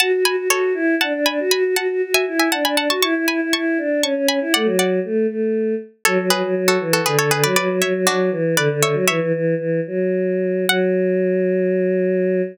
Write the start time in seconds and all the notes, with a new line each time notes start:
0.00 F#4 F#5 A5
0.12 F#4
0.25 F#4 G#5 B5
0.36 F#4
0.50 F#4 A4 C#5
0.74 E4
1.01 D4 F#5 A5
1.13 D4
1.26 D4 G#5 B5
1.40 F#4
1.51 F#4 G#5 B5
1.65 F#4
1.75 F#4 F#5 A5
1.90 F#4
2.03 F#4
2.14 E5 G#5
2.28 E4
2.39 E5 G#5
2.52 D4 F#5 A5
2.64 D4 G#5 B5
2.76 D4 F#5 A5
2.89 F#4 A5 C#6
3.02 E4 A5 C#6
3.14 E4
3.28 E4 G#5 B5
3.41 E4
3.53 E4 A5 C#6
3.78 D4
4.02 C#4 A5 C#6
4.16 C#4
4.28 C#4 G#5 B5
4.41 E4
4.54 A3 D5 F#5
4.64 F#3
4.79 D5 F#5
5.05 A3
5.29 A3
6.05 F#3 A4 C#5
6.19 F#3
6.30 F#3 G#4 B4
6.43 F#3
6.57 F#3
6.68 F#4 A4
6.80 E3
6.93 F#4 A4
7.05 D3 G#4 B4
7.19 D3 A4 C#5
7.31 D3 G#4 B4
7.43 F#3 B4 D5
7.56 F#3 B4 D5
7.69 F#3
7.82 F#3 C#5 E5
7.94 F#3
8.07 F#3 D4 F#4
8.31 E3
8.57 D3 B4 D5
8.71 D3
8.82 D3 C#5 E5
8.93 F#3
9.08 E3 C#5 E5
9.20 E3
9.34 E3
9.58 E3
9.87 F#3
10.67 F#3 F#5